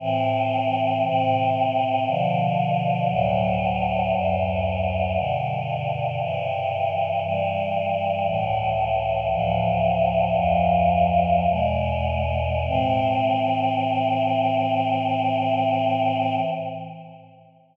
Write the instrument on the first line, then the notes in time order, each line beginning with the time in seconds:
choir aahs
0.00 A2 E3 C4
1.05 A2 C3 C4
2.07 B2 D3 F3
3.10 D2 A2 F#3
4.14 D2 F#2 F#3
5.16 G2 B2 D3
6.20 G2 C3 E3
7.24 G2 E3 G3
8.26 C#2 A2 E3
9.31 D2 A2 F3
10.35 D2 F2 F3
11.49 E2 B2 G#3
12.66 A2 E3 C4